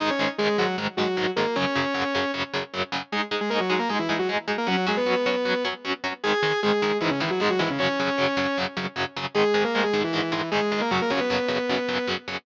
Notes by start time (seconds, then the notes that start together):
0.00 G#2 D#3 G#3 D#4 D#5
0.10 C#4 C#5
0.19 G#2 D#3 G#3
0.38 G#2 D#3 G#3 G#4
0.58 G#2 D#3 F#3 G#3 F#4
0.78 G#2 D#3 G#3
0.97 G#2 D#3 F#3 G#3 F#4
1.17 G#2 D#3 G#3
1.36 G#2 D#3 G#3 A#3 A#4
1.56 F#2 C#3 F#3 C#4 C#5
1.75 F#2 C#3 F#3
1.94 F#2 C#3 F#3
2.15 F#2 C#3 F#3
2.34 F#2 C#3 F#3
2.54 F#2 C#3 F#3
2.74 F#2 C#3 F#3
2.92 F#2 C#3 F#3
3.12 G#3 D#4 G#4
3.31 G#3 D#4 G#4
3.41 G#3 G#4
3.50 G#3 A#3 D#4 G#4 A#4
3.60 F#3 F#4
3.70 F#3 G#3 D#4 F#4 G#4
3.79 A#3 A#4
3.89 G#3 D#4 G#4
3.99 E3 E4
4.09 G#3 D#4 G#4
4.19 F#3 F#4
4.29 G#3 D#4 G#4
4.48 G#3 D#4 G#4
4.58 A#3 A#4
4.67 F#3 C#4 F#4
4.87 F#3 G#3 C#4 F#4 G#4
4.97 B3 B4
5.06 F#3 C#4 F#4
5.26 F#3 C#4 F#4
5.45 F#3 C#4 F#4
5.65 F#3 C#4 F#4
5.85 F#3 C#4 F#4
6.04 F#3 C#4 F#4
6.24 G#2 D#3 G#3 G#4 G#5
6.43 G#2 D#3 G#3
6.63 G#2 D#3 G#3 G#4
6.82 G#2 D#3 G#3
7.01 G#2 D#3 E3 G#3 E4
7.10 C#3 C#4
7.20 G#2 D#3 E3 G#3 E4
7.30 F#3 F#4
7.40 G#2 D#3 G#3 G#4
7.50 F#3 F#4
7.59 G#2 D#3 E3 G#3 E4
7.70 C#3 C#4
7.79 F#2 C#3 F#3 C#4 C#5
8.00 F#2 C#3 F#3
8.18 F#2 C#3 F#3
8.37 F#2 C#3 F#3
8.58 F#2 C#3 F#3
8.77 F#2 C#3 F#3
8.96 F#2 C#3 F#3
9.16 F#2 C#3 F#3
9.35 G#2 D#3 G#3 G#4
9.54 G#2 D#3 G#3
9.64 A#3 A#4
9.75 G#2 D#3 G#3
9.83 G#3 G#4
9.93 G#2 D#3 G#3
10.04 E3 E4
10.13 G#2 D#3 G#3
10.32 G#2 D#3 E3 G#3 E4
10.51 G#2 D#3 G#3 G#4
10.72 G#2 D#3 G#3
10.81 A#3 A#4
10.91 F#2 C#3 F#3 F#4
11.02 A#3 A#4
11.10 F#2 C#3 F#3 C#4 C#5
11.20 B3 B4
11.30 F#2 C#3 F#3
11.48 F#2 C#3 F#3
11.69 F#2 C#3 F#3
11.89 F#2 C#3 F#3
12.07 F#2 C#3 F#3
12.28 F#2 C#3 F#3